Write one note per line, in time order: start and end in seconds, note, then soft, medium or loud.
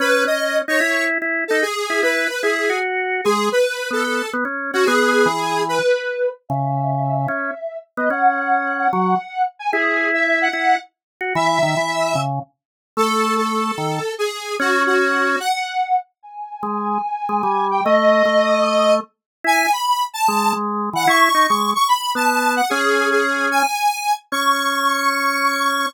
0.00 0.24 C#4 loud
0.00 0.23 B4 loud
0.25 0.62 C#4 medium
0.25 0.57 D#5 medium
0.68 0.80 D#4 loud
0.68 1.04 C#5 loud
0.80 1.18 E4 loud
1.22 1.44 E4 loud
1.48 1.63 D#4 medium
1.48 1.61 A4 loud
1.62 2.01 G#4 loud
1.90 2.02 E4 medium
2.03 2.28 E4 loud
2.03 2.29 B4 loud
2.29 2.41 B4 medium
2.42 2.69 E4 medium
2.42 2.78 G#4 loud
2.70 3.21 F#4 medium
3.24 3.49 G#3 loud
3.24 3.48 G#4 loud
3.52 3.89 B4 loud
3.91 4.22 B3 medium
3.91 4.30 A4 loud
4.33 4.44 B3 loud
4.45 4.71 C#4 medium
4.73 4.85 C#4 loud
4.73 4.86 F#4 loud
4.85 5.27 B3 loud
4.85 5.63 G#4 loud
5.26 5.79 E3 medium
5.69 6.29 B4 loud
6.49 7.27 C#3 loud
6.49 7.15 E5 loud
7.16 7.77 E5 medium
7.28 7.51 C#4 medium
7.97 8.09 B3 loud
7.97 8.09 D#5 loud
8.10 8.88 C#4 loud
8.10 8.74 F#5 loud
8.78 9.42 F#5 medium
8.93 9.15 F#3 loud
9.59 9.71 G#5 loud
9.72 10.48 E4 loud
9.72 10.08 G#4 loud
10.14 10.39 E5 loud
10.41 10.77 F#5 loud
10.53 10.76 E4 medium
11.21 11.34 F#4 medium
11.35 11.59 E3 loud
11.35 12.20 E5 loud
11.63 11.75 D#3 loud
11.77 12.14 E3 medium
12.15 12.39 C#3 loud
12.97 13.72 A3 loud
12.97 13.35 A4 loud
13.37 14.13 A4 medium
13.78 13.99 D#3 medium
14.18 14.55 G#4 loud
14.60 15.36 C#4 loud
14.60 14.83 F#4 loud
14.86 15.39 F#4 loud
15.40 15.96 F#5 loud
16.23 16.88 G#5 loud
16.63 16.98 G#3 medium
16.89 17.65 G#5 loud
17.29 17.42 G#3 medium
17.43 17.81 G3 loud
17.71 17.83 G5 medium
17.85 18.23 A3 loud
17.85 18.94 D#5 loud
18.25 19.00 A3 medium
19.44 19.67 E4 loud
19.44 19.71 G#5 loud
19.72 20.03 B5 medium
20.14 20.52 A5 loud
20.28 20.53 G#3 loud
20.53 20.90 G#3 loud
20.93 21.06 E3 medium
20.93 21.08 F#5 loud
21.07 21.29 E4 loud
21.07 21.46 C#6 loud
21.34 21.47 D#4 medium
21.48 21.74 G#3 medium
21.48 21.71 C#6 medium
21.75 21.87 C#6 loud
21.88 22.11 B5 loud
22.15 22.61 B3 medium
22.15 22.53 A5 loud
22.56 22.69 F#5 medium
22.70 23.63 C#4 loud
22.70 23.09 G#4 loud
23.11 23.48 G#4 loud
23.51 24.13 G#5 loud
24.32 25.86 C#4 loud
24.32 25.86 C#6 loud